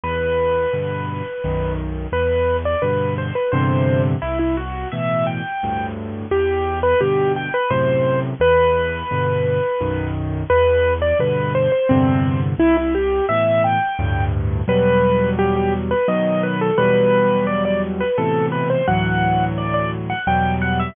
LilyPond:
<<
  \new Staff \with { instrumentName = "Acoustic Grand Piano" } { \time 3/4 \key e \minor \tempo 4 = 86 b'2~ b'8 r8 | b'8. d''16 b'8 c''16 b'16 c''8. r16 | e'16 e'16 fis'8 e''8 g''4 r8 | g'8. b'16 g'8 g''16 b'16 c''8. r16 |
b'2~ b'8 r8 | b'8. d''16 b'8 c''16 c''16 c'8. r16 | e'16 e'16 g'8 e''8 g''4 r8 | b'4 g'16 g'16 r16 b'16 dis''8 b'16 a'16 |
b'4 d''16 d''16 r16 b'16 a'8 b'16 c''16 | fis''4 d''16 d''16 r16 fis''16 g''8 fis''16 e''16 | }
  \new Staff \with { instrumentName = "Acoustic Grand Piano" } { \clef bass \time 3/4 \key e \minor e,4 <g, b, d>4 <b,, fis, dis>4 | e,4 <g, b, d>4 <e, g, c d>4 | c,4 <a, b, e>4 <d, g, a,>4 | e,4 <g, b, d>4 <fis, a, c>4 |
e,4 <g, b, d>4 <b,, fis, dis>4 | e,4 <g, b, d>4 <e, g, c d>4 | c,4 <a, b, e>4 <d, g, a,>4 | <e, b, fis g>2 <b, dis fis>4 |
<e, b, fis g>2 <a, b, c e>4 | <d, a, e fis>2 <e, b, fis g>4 | }
>>